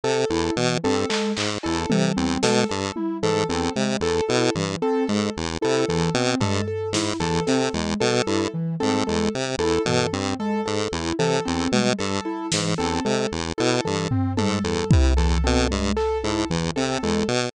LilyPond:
<<
  \new Staff \with { instrumentName = "Lead 1 (square)" } { \clef bass \time 6/8 \tempo 4. = 75 c8 e,8 b,8 g,8 r8 aes,8 | e,8 c8 e,8 b,8 g,8 r8 | aes,8 e,8 c8 e,8 b,8 g,8 | r8 aes,8 e,8 c8 e,8 b,8 |
g,8 r8 aes,8 e,8 c8 e,8 | b,8 g,8 r8 aes,8 e,8 c8 | e,8 b,8 g,8 r8 aes,8 e,8 | c8 e,8 b,8 g,8 r8 aes,8 |
e,8 c8 e,8 b,8 g,8 r8 | aes,8 e,8 c8 e,8 b,8 g,8 | r8 aes,8 e,8 c8 e,8 b,8 | }
  \new Staff \with { instrumentName = "Ocarina" } { \time 6/8 r8 e'8 e8 c'8 aes8 r8 | e'8 e8 c'8 aes8 r8 e'8 | e8 c'8 aes8 r8 e'8 e8 | c'8 aes8 r8 e'8 e8 c'8 |
aes8 r8 e'8 e8 c'8 aes8 | r8 e'8 e8 c'8 aes8 r8 | e'8 e8 c'8 aes8 r8 e'8 | e8 c'8 aes8 r8 e'8 e8 |
c'8 aes8 r8 e'8 e8 c'8 | aes8 r8 e'8 e8 c'8 aes8 | r8 e'8 e8 c'8 aes8 r8 | }
  \new Staff \with { instrumentName = "Acoustic Grand Piano" } { \time 6/8 a'8 a'8 r8 a'8 a'8 r8 | a'8 a'8 r8 a'8 a'8 r8 | a'8 a'8 r8 a'8 a'8 r8 | a'8 a'8 r8 a'8 a'8 r8 |
a'8 a'8 r8 a'8 a'8 r8 | a'8 a'8 r8 a'8 a'8 r8 | a'8 a'8 r8 a'8 a'8 r8 | a'8 a'8 r8 a'8 a'8 r8 |
a'8 a'8 r8 a'8 a'8 r8 | a'8 a'8 r8 a'8 a'8 r8 | a'8 a'8 r8 a'8 a'8 r8 | }
  \new DrumStaff \with { instrumentName = "Drums" } \drummode { \time 6/8 r4. r8 hc8 hc8 | cb8 tommh4 sn4 tommh8 | r4. r4. | r4. r4. |
tomfh4 sn8 r8 sn4 | tommh4. tommh4. | r8 tomfh4 r4. | r4 tommh8 r4 sn8 |
r4. r4 tomfh8 | tommh4 bd8 r4. | hc4. r4. | }
>>